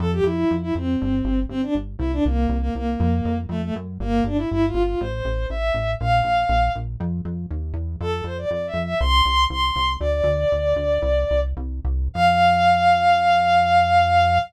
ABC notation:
X:1
M:4/4
L:1/16
Q:1/4=120
K:F
V:1 name="Violin"
A G E3 E C6 C D z2 | E D B,3 B, B,6 A, A, z2 | B,2 D E (3E2 F2 F2 c4 e4 | f6 z10 |
A2 c d (3d2 e2 e2 c'4 c'4 | "^rit." d12 z4 | f16 |]
V:2 name="Synth Bass 1" clef=bass
F,,2 F,,2 F,,2 F,,2 G,,,2 G,,,2 G,,,2 G,,,2 | C,,2 C,,2 C,,2 C,,2 F,,2 F,,2 F,,2 _G,,2 | G,,,2 G,,,2 G,,,2 G,,,2 A,,,2 A,,,2 A,,,2 A,,,2 | B,,,2 B,,,2 B,,,2 B,,,2 F,,2 F,,2 _E,,2 =E,,2 |
F,,2 F,,2 F,,2 F,,2 C,,2 C,,2 C,,2 C,,2 | "^rit." D,,2 D,,2 D,,2 D,,2 C,,2 C,,2 C,,2 C,,2 | F,,16 |]